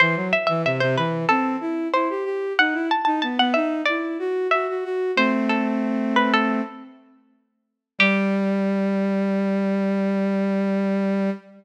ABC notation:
X:1
M:4/4
L:1/16
Q:1/4=93
K:G
V:1 name="Pizzicato Strings"
c2 e e e c B2 A4 c4 | f2 a a a f e2 d4 e4 | "^rit." c2 A4 B A3 z6 | G16 |]
V:2 name="Violin"
E, F, z E, C, C, E,2 C2 E2 E G G2 | ^D E z D B, B, D2 E2 F2 F F F2 | "^rit." [A,C]10 z6 | G,16 |]